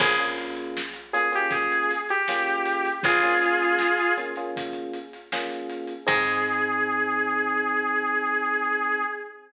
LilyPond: <<
  \new Staff \with { instrumentName = "Lead 2 (sawtooth)" } { \time 4/4 \key aes \major \tempo 4 = 79 aes'16 r4 r16 aes'16 g'16 aes'8. g'4~ g'16 | <f' aes'>4. r2 r8 | aes'1 | }
  \new Staff \with { instrumentName = "Electric Piano 1" } { \time 4/4 \key aes \major <bes des' f' aes'>16 <bes des' f' aes'>4~ <bes des' f' aes'>16 <bes des' f' aes'>16 <bes des' f' aes'>4~ <bes des' f' aes'>16 <bes des' f' aes'>4~ | <bes des' f' aes'>16 <bes des' f' aes'>4~ <bes des' f' aes'>16 <bes des' f' aes'>16 <bes des' f' aes'>4~ <bes des' f' aes'>16 <bes des' f' aes'>4 | <c' ees' aes'>1 | }
  \new Staff \with { instrumentName = "Electric Bass (finger)" } { \clef bass \time 4/4 \key aes \major bes,,1 | bes,,1 | aes,1 | }
  \new DrumStaff \with { instrumentName = "Drums" } \drummode { \time 4/4 <cymc bd>16 hh16 hh16 hh16 sn16 hh16 hh16 hh16 <hh bd>16 hh16 hh16 hh16 sn16 hh16 hh16 hh16 | <hh bd>16 hh16 hh16 hh16 sn16 hh16 hh16 hh16 <hh bd>16 hh16 hh16 hh16 sn16 hh16 hh16 hh16 | <cymc bd>4 r4 r4 r4 | }
>>